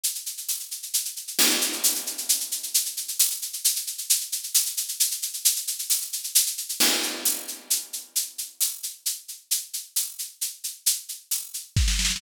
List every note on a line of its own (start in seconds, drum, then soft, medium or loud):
0.03 shaker loud
0.15 shaker medium
0.26 shaker medium
0.37 shaker medium
0.49 tambourine medium
0.49 shaker medium
0.60 shaker medium
0.71 shaker medium
0.83 shaker medium
0.94 shaker loud
1.05 shaker medium
1.16 shaker medium
1.27 shaker medium
1.39 crash loud
1.50 shaker medium
1.61 shaker loud
1.73 shaker medium
1.84 tambourine medium
1.84 shaker loud
1.95 shaker medium
2.06 shaker medium
2.18 shaker medium
2.29 shaker loud
2.40 shaker medium
2.52 shaker medium
2.63 shaker medium
2.74 shaker loud
2.85 shaker medium
2.97 shaker medium
3.08 shaker medium
3.19 tambourine loud
3.19 shaker loud
3.31 shaker medium
3.42 shaker medium
3.53 shaker medium
3.64 shaker loud
3.76 shaker medium
3.87 shaker medium
3.98 shaker medium
4.10 shaker loud
4.21 shaker medium
4.32 shaker medium
4.43 shaker medium
4.54 tambourine medium
4.54 shaker loud
4.66 shaker medium
4.77 shaker loud
4.88 shaker medium
5.00 shaker loud
5.11 shaker medium
5.22 shaker medium
5.34 shaker medium
5.45 shaker loud
5.56 shaker medium
5.67 shaker medium
5.79 shaker medium
5.90 tambourine medium
5.90 shaker loud
6.01 shaker medium
6.13 shaker medium
6.24 shaker medium
6.35 shaker loud
6.46 shaker medium
6.58 shaker medium
6.69 shaker medium
6.80 crash loud
7.03 shaker medium
7.25 tambourine medium
7.25 shaker loud
7.48 shaker medium
7.70 shaker loud
7.93 shaker medium
8.16 shaker loud
8.38 shaker medium
8.61 tambourine medium
8.61 shaker loud
8.83 shaker medium
9.06 shaker loud
9.28 shaker medium
9.51 shaker loud
9.73 shaker medium
9.96 tambourine medium
9.96 shaker loud
10.19 shaker medium
10.41 shaker medium
10.64 shaker medium
10.86 shaker loud
11.09 shaker medium
11.31 tambourine medium
11.31 shaker medium
11.54 shaker medium
11.76 kick medium
11.76 snare medium
11.88 snare medium
11.99 snare medium
12.05 snare medium
12.10 snare medium
12.16 snare loud